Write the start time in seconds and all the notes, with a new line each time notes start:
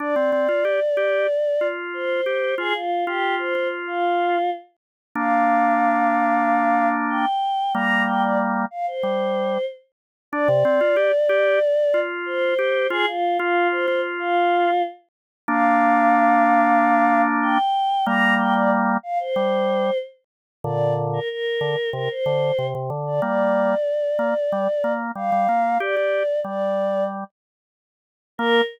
0.00 D4 D5
0.16 C4
0.32 C4
0.49 F4
0.65 G4
0.97 G4
1.61 F4
1.93 C5
2.26 G4
2.58 F4 G#4
2.74 F4
3.06 F4 G4
3.39 C5
3.55 F4
3.87 F4
5.15 A#3 D4 F5
7.10 G5
7.74 G3 A#3 A#5
8.07 G5
8.23 D5
8.71 F5
8.87 C5
9.03 G3
10.32 D4 D5
10.48 C3
10.65 C4
10.81 F4
10.96 G4
11.29 G4
11.94 F4
12.26 C5
12.59 G4
12.90 F4 G#4
13.07 F4
13.39 F4
13.71 C5
13.88 F4
14.19 F4
15.48 A#3 D4 F5
17.42 G5
18.06 G3 A#3 A#5
18.39 G5
18.55 D5
19.03 F5
19.20 C5
19.36 G3
20.64 A#2 D3 D5
21.13 A#4
21.29 A#4
21.61 D3
21.93 C3 A#4
22.10 C5
22.26 D3
22.58 C3
22.75 C3
22.90 D3
23.07 D5
23.22 G3 A#3 D5
24.19 A#3
24.52 G3
24.84 A#3
25.15 G3 F5
25.32 G3
25.49 A#3
25.80 G4 D5
25.97 G4
26.44 G3 D5
28.38 A#3 A#4